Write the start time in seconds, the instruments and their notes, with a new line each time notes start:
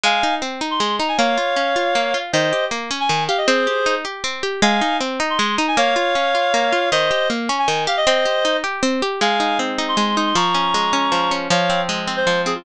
0.04 pizzicato strings G#3, clarinet F5 G#5
0.23 pizzicato strings D#4
0.42 pizzicato strings C4
0.61 pizzicato strings D#4
0.71 clarinet C6
0.80 pizzicato strings G#3
0.99 pizzicato strings D#4, clarinet A#5
1.08 clarinet G#5
1.18 pizzicato strings A#3, clarinet C#5 F5
1.38 pizzicato strings F4
1.56 pizzicato strings C#4
1.76 pizzicato strings F4
1.95 pizzicato strings A#3
2.14 pizzicato strings F4
2.33 pizzicato strings D#3, clarinet C5 D#5
2.53 pizzicato strings G4
2.71 pizzicato strings A#3
2.91 pizzicato strings C#4
3.00 clarinet G#5
3.09 pizzicato strings D#3
3.28 pizzicato strings G4, clarinet F5
3.38 clarinet D#5
3.47 pizzicato strings C4, clarinet G#4 C5
3.67 pizzicato strings G4
3.86 pizzicato strings D#4
4.05 pizzicato strings G4
4.24 pizzicato strings C4
4.43 pizzicato strings G4
4.62 pizzicato strings G#3, clarinet F5 G#5
4.81 pizzicato strings D#4
5.01 pizzicato strings C4
5.20 pizzicato strings D#4
5.30 clarinet C6
5.39 pizzicato strings G#3
5.57 pizzicato strings D#4, clarinet A#5
5.68 clarinet G#5
5.77 pizzicato strings A#3, clarinet C#5 F5
5.96 pizzicato strings F4
6.15 pizzicato strings C#4
6.35 pizzicato strings F4
6.54 pizzicato strings A#3
6.72 pizzicato strings F4
6.92 pizzicato strings D#3, clarinet C5 D#5
7.11 pizzicato strings G4
7.30 pizzicato strings A#3
7.49 pizzicato strings C#4
7.59 clarinet G#5
7.68 pizzicato strings D#3
7.87 pizzicato strings G4, clarinet F5
7.97 clarinet D#5
8.07 pizzicato strings C4, clarinet C5 D#5
8.25 pizzicato strings G4
8.45 pizzicato strings D#4
8.64 pizzicato strings G4
8.83 pizzicato strings C4
9.02 pizzicato strings G4
9.21 pizzicato strings G#3, clarinet F5 G#5
9.40 pizzicato strings D#4
9.59 pizzicato strings C4
9.78 pizzicato strings D#4
9.88 clarinet C6
9.97 pizzicato strings G#3
10.17 pizzicato strings D#4, clarinet C6
10.26 clarinet C6
10.35 pizzicato strings F3, clarinet A#5 C#6
10.54 pizzicato strings C#4
10.74 pizzicato strings G#3
10.93 pizzicato strings C#4
11.12 pizzicato strings F3
11.31 pizzicato strings C#4
11.50 pizzicato strings F3, clarinet C#5 F5
11.70 pizzicato strings C4
11.89 pizzicato strings G#3
12.07 pizzicato strings C4
12.16 clarinet C5
12.27 pizzicato strings F3
12.46 pizzicato strings C4, clarinet G#4
12.55 clarinet F4